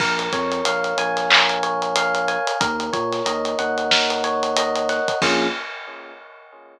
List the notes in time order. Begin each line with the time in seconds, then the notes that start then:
0.00 A#1 A#4, kick, crash
0.19 closed hi-hat
0.32 F2 C#5, kick, snare, closed hi-hat
0.52 closed hi-hat
0.65 A#1 F5, closed hi-hat
0.84 closed hi-hat
0.97 A#1 G#5, closed hi-hat
1.17 snare, closed hi-hat
1.30 A#4, clap
1.49 closed hi-hat
1.63 C#5, closed hi-hat
1.82 closed hi-hat
1.96 F5, closed hi-hat
2.15 closed hi-hat
2.28 G#5, closed hi-hat
2.47 closed hi-hat
2.60 D#2 A#4, kick, closed hi-hat
2.80 closed hi-hat
2.93 A#2 C#5, kick, closed hi-hat
3.13 snare, closed hi-hat
3.26 D#2 D#5, closed hi-hat
3.45 closed hi-hat
3.59 D#2 F#5, closed hi-hat
3.78 closed hi-hat
3.91 A#4, snare
4.10 closed hi-hat
4.24 C#5, closed hi-hat
4.43 closed hi-hat
4.57 D#5, closed hi-hat
4.76 closed hi-hat
4.89 F#5, snare, closed hi-hat
5.08 kick, closed hi-hat
5.22 A#1 A#3 C#4 F4 G#4, kick, crash